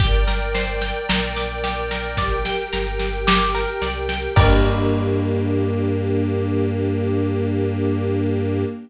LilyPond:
<<
  \new Staff \with { instrumentName = "Pizzicato Strings" } { \time 4/4 \key g \dorian \tempo 4 = 55 g'16 bes'16 c''16 g''16 bes''16 d'''16 g'16 bes'16 d''16 g''16 bes''16 d'''16 g'16 bes'16 d''16 g''16 | <g' bes' d''>1 | }
  \new Staff \with { instrumentName = "String Ensemble 1" } { \time 4/4 \key g \dorian <bes' d'' g''>2 <g' bes' g''>2 | <bes d' g'>1 | }
  \new Staff \with { instrumentName = "Synth Bass 2" } { \clef bass \time 4/4 \key g \dorian g,,4 bes,,4. g,,4 c,8 | g,1 | }
  \new DrumStaff \with { instrumentName = "Drums" } \drummode { \time 4/4 <bd sn>16 sn16 sn16 sn16 sn16 sn16 sn16 sn16 <bd sn>16 sn16 sn16 sn16 sn16 sn16 sn16 sn16 | <cymc bd>4 r4 r4 r4 | }
>>